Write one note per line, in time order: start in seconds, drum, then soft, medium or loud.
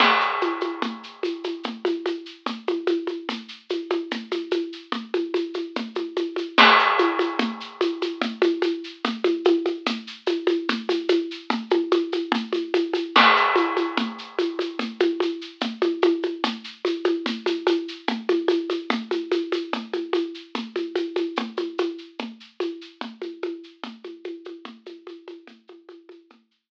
0.00 crash loud
0.00 low conga loud
0.00 shaker medium
0.21 shaker medium
0.41 high conga medium
0.41 shaker medium
0.61 high conga medium
0.61 shaker medium
0.82 low conga loud
0.82 shaker medium
1.03 shaker medium
1.23 high conga medium
1.23 shaker medium
1.44 high conga medium
1.44 shaker medium
1.63 low conga medium
1.63 shaker medium
1.85 high conga medium
1.85 shaker medium
2.06 high conga medium
2.06 shaker medium
2.26 shaker medium
2.46 low conga medium
2.46 shaker medium
2.67 high conga medium
2.67 shaker medium
2.87 high conga medium
2.87 shaker medium
3.07 high conga medium
3.07 shaker medium
3.29 low conga medium
3.29 shaker medium
3.48 shaker medium
3.69 high conga medium
3.69 shaker medium
3.90 high conga medium
3.90 shaker medium
4.11 low conga medium
4.11 shaker medium
4.31 high conga medium
4.31 shaker medium
4.51 high conga medium
4.51 shaker medium
4.73 shaker medium
4.92 low conga medium
4.92 shaker medium
5.14 high conga medium
5.14 shaker medium
5.34 high conga medium
5.34 shaker medium
5.54 high conga medium
5.54 shaker medium
5.76 low conga medium
5.76 shaker medium
5.95 high conga medium
5.95 shaker medium
6.16 high conga medium
6.16 shaker medium
6.36 high conga medium
6.36 shaker medium
6.58 crash loud
6.58 low conga loud
6.58 shaker medium
6.79 shaker medium
6.99 high conga medium
6.99 shaker medium
7.19 high conga medium
7.19 shaker medium
7.39 low conga loud
7.39 shaker medium
7.60 shaker medium
7.81 high conga medium
7.81 shaker medium
8.02 high conga medium
8.02 shaker medium
8.21 low conga loud
8.21 shaker medium
8.42 high conga medium
8.42 shaker medium
8.62 high conga medium
8.62 shaker medium
8.84 shaker medium
9.04 low conga loud
9.04 shaker medium
9.24 high conga medium
9.24 shaker medium
9.45 high conga loud
9.45 shaker medium
9.66 high conga medium
9.66 shaker medium
9.86 low conga loud
9.86 shaker loud
10.07 shaker medium
10.26 high conga medium
10.26 shaker medium
10.47 high conga medium
10.47 shaker medium
10.69 low conga loud
10.69 shaker medium
10.89 high conga medium
10.89 shaker medium
11.09 high conga medium
11.09 shaker medium
11.31 shaker medium
11.50 low conga loud
11.50 shaker medium
11.70 high conga medium
11.70 shaker medium
11.91 high conga medium
11.91 shaker medium
12.12 high conga medium
12.12 shaker medium
12.32 low conga loud
12.32 shaker medium
12.53 high conga medium
12.53 shaker medium
12.74 high conga medium
12.74 shaker medium
12.93 high conga medium
12.93 shaker medium
13.15 crash loud
13.15 low conga loud
13.15 shaker medium
13.36 shaker medium
13.56 high conga medium
13.56 shaker medium
13.77 high conga medium
13.77 shaker medium
13.97 low conga loud
13.97 shaker medium
14.18 shaker medium
14.39 high conga medium
14.39 shaker medium
14.59 high conga medium
14.59 shaker medium
14.79 low conga loud
14.79 shaker medium
15.00 high conga medium
15.00 shaker medium
15.20 high conga medium
15.20 shaker medium
15.41 shaker medium
15.61 low conga loud
15.61 shaker medium
15.82 high conga medium
15.82 shaker medium
16.02 high conga medium
16.02 shaker medium
16.23 high conga medium
16.23 shaker medium
16.44 low conga loud
16.44 shaker loud
16.64 shaker medium
16.85 high conga medium
16.85 shaker medium
17.04 high conga medium
17.04 shaker medium
17.26 low conga loud
17.26 shaker medium
17.46 high conga medium
17.46 shaker medium
17.67 high conga medium
17.67 shaker medium
17.88 shaker medium
18.08 low conga loud
18.08 shaker medium
18.29 high conga medium
18.29 shaker medium
18.48 high conga medium
18.48 shaker medium
18.70 high conga medium
18.70 shaker medium
18.90 low conga loud
18.90 shaker medium
19.11 high conga medium
19.11 shaker medium
19.32 high conga medium
19.32 shaker medium
19.52 high conga medium
19.52 shaker medium
19.73 low conga medium
19.73 shaker medium
19.93 high conga medium
19.93 shaker medium
20.13 high conga medium
20.13 shaker medium
20.34 shaker medium
20.55 low conga medium
20.55 shaker medium
20.76 high conga medium
20.76 shaker medium
20.96 high conga medium
20.96 shaker medium
21.16 high conga medium
21.16 shaker medium
21.36 low conga loud
21.36 shaker medium
21.57 high conga medium
21.57 shaker medium
21.78 high conga medium
21.78 shaker medium
21.98 shaker medium
22.19 low conga medium
22.19 shaker medium
22.40 shaker medium
22.60 high conga medium
22.60 shaker medium
22.81 shaker medium
23.01 low conga medium
23.01 shaker medium
23.22 high conga medium
23.22 shaker medium
23.42 high conga medium
23.42 shaker medium
23.63 shaker medium
23.84 low conga loud
23.84 shaker medium
24.04 high conga medium
24.04 shaker medium
24.24 high conga medium
24.24 shaker medium
24.45 high conga medium
24.45 shaker medium
24.65 low conga loud
24.65 shaker medium
24.86 high conga medium
24.86 shaker medium
25.07 high conga medium
25.07 shaker medium
25.28 high conga medium
25.28 shaker medium
25.47 low conga medium
25.47 shaker medium
25.67 high conga medium
25.67 shaker medium
25.89 high conga medium
25.89 shaker medium
26.09 high conga medium
26.09 shaker medium
26.30 low conga medium
26.30 shaker medium
26.51 shaker medium